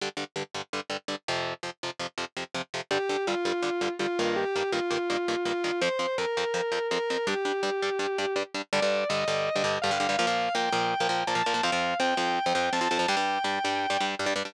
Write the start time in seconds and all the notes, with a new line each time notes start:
0.01 G2 D3 G3
0.17 G2 D3 G3
0.36 G2 D3 G3
0.54 G2 D3 G3
0.73 G2 D3 G3
0.90 G2 D3 G3
1.08 G2 D3 G3
1.28 F2 C3 F3
1.63 F2 C3 F3
1.83 F2 C3 F3
1.99 F2 C3 F3
2.18 F2 C3 F3
2.37 F2 C3 F3
2.54 F2 C3 F3
2.74 F2 C3 F3
2.91 G2 D3 G3 G4
3.09 G2 D3 G3
3.27 G2 D3 G3 F4
3.45 G2 D3 G3
3.62 G2 D3 G3
3.81 G2 D3 G3
3.99 G2 D3 G3 F4
4.19 G2 D#3 A#3
4.36 G4
4.56 G2 D#3 A#3
4.72 G2 D#3 A#3 F4
4.91 G2 D#3 A#3
5.10 G2 D#3 A#3
5.28 G2 D#3 A#3
5.45 G2 D#3 A#3 F4
5.64 G2 D#3 A#3
5.82 F2 F3 C4 C5
5.99 F2 F3 C4
6.18 F2 F3 C4 A#4
6.37 F2 F3 C4
6.54 F2 F3 C4
6.72 F2 F3 C4
6.91 F2 F3 C4 A#4
7.10 F2 F3 C4
7.27 G2 G3 D4 G4
7.45 G2 G3 D4
7.63 G2 G3 D4
7.82 G2 G3 D4
7.99 G2 G3 D4
8.18 G2 G3 D4
8.36 G2 G3 D4
8.54 G2 G3 D4
8.73 G2 D3 G3 D5
8.82 G2 D3 G3
9.09 G2 D3 G3 D#5
9.28 G2 D3 G3
9.56 G2 D3 G3
9.64 G2 D3 G3
9.82 G2 D3 G3 F5
9.91 G2 D3 G3
10.00 G2 D3 G3
10.09 G2 D3 G3
10.18 A#2 F3 A#3 F5
10.27 A#2 F3 A#3
10.55 A#2 F3 A#3 G5
10.72 A#2 F3 A#3
11.00 A#2 F3 A#3
11.09 A#2 F3 A#3
11.27 A#2 F3 A#3 A5
11.35 A#2 F3 A#3
11.46 A#2 F3 A#3
11.54 A#2 F3 A#3
11.63 F2 F3 C4 F5
11.72 F2 F3 C4
12.00 F2 F3 C4 G5
12.17 F2 F3 C4
12.46 F2 F3 C4
12.55 F2 F3 C4
12.73 F2 F3 C4 A5
12.81 F2 F3 C4
12.91 F2 F3 C4
12.99 F2 F3 C4
13.08 G2 G3 D4 G5
13.17 G2 G3 D4
13.44 G2 G3 D4
13.64 G2 G3 D4
13.90 G2 G3 D4
14.00 G2 G3 D4
14.19 G2 G3 D4
14.26 G2 G3 D4
14.36 G2 G3 D4
14.45 G2 G3 D4